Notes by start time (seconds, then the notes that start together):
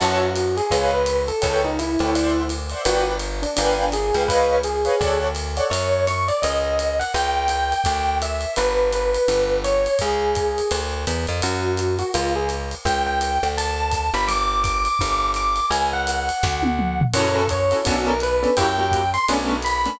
0.00 F#2 F#4 C#5 E5 F#5 A5, crash, ride
0.36 hi-hat pedal, ride
0.57 G#4, ride
0.71 C#2 B4 C#5 D#5 F5, kick, ride
0.94 B4
1.06 hi-hat pedal, ride
1.28 A4, ride
1.42 C#2 A4 B4 C#5 G5, kick, ride
1.65 D#4
1.79 E4, hi-hat pedal, ride
1.99 D2 A4 B4 C#5 G5, ride
2.15 C5 D5 E5 F#5, ride
2.49 hi-hat pedal, ride
2.70 C5 D5 E5 F#5, ride
2.85 G1 F#4 B4 D5 F#5 G5, ride
3.19 hi-hat pedal, ride
3.42 D4, ride
3.56 G1 D4 B4 F5 G5 G#5, ride
3.92 G#4, hi-hat pedal, ride
4.13 C#2 B4 F5 G5 G#5, ride
4.28 B4 C#5 D#5 F5, kick, ride
4.63 G#4, hi-hat pedal, ride
4.85 B4 C#5 D#5 F5, ride
5.00 D2 A4 C#5 D5 F#5, kick, ride
5.35 hi-hat pedal, ride
5.57 A4 C#5 D5 F#5, ride
5.70 F#2 C#5, ride
6.07 C#6, hi-hat pedal, ride
6.28 D5, ride
6.42 C#2 D#5, ride
6.79 hi-hat pedal, ride
6.99 F#5, ride
7.14 C#2 G5, ride
7.48 G5, hi-hat pedal, ride
7.72 ride
7.84 D2, kick, ride
8.22 E5, hi-hat pedal, ride
8.41 ride
8.56 G1 B4, ride
8.92 B4, hi-hat pedal, ride
9.15 ride
9.28 G1, ride
9.64 C#5, hi-hat pedal, ride
9.86 ride
9.99 C#2 G#4, kick, ride
10.35 kick, hi-hat pedal, ride
10.58 ride
10.71 D2, ride
11.07 E2, hi-hat pedal, ride
11.27 F2, ride
11.42 F#2 F#4, ride
11.77 hi-hat pedal, ride
11.99 F#4, ride
12.14 C#2 F4, ride
12.36 G#4
12.49 hi-hat pedal, ride
12.71 ride
12.85 C#2 G5, kick, ride
13.06 G5
13.21 hi-hat pedal, ride
13.43 D2, ride
13.58 A5, ride
13.92 kick, hi-hat pedal, ride
14.14 G1 B5, ride
14.28 D6, ride
14.63 D6, kick, hi-hat pedal, ride
14.85 ride
14.99 G1, kick, ride
15.34 D6, hi-hat pedal, ride
15.56 ride
15.70 C#2 G#5, ride
15.93 F#5
16.07 hi-hat pedal, ride
16.29 ride
16.43 D2, kick, snare
16.63 high tom
16.79 mid tom
17.01 floor tom
17.14 F#2 C#4 E4 F#4 A4 C#5, crash, ride
17.35 A4
17.48 C#5, kick, hi-hat pedal, ride
17.71 C#4 E4 F#4 A4, ride
17.85 B1 B3 C#4 D4 F#4 A4, kick, ride
18.07 A#4
18.20 B4, hi-hat pedal, ride
18.43 B3 C#4 D4 A4, ride
18.57 F#2 A#3 E4 F#4 G4 G5, kick, ride
18.78 A#3 E4 F#4 G4
18.91 kick, hi-hat pedal, ride
19.14 C6, ride
19.28 B1 A3 B3 C#4 D4, ride
19.62 B5, hi-hat pedal, ride
19.86 A3 B3 C#4 D4, ride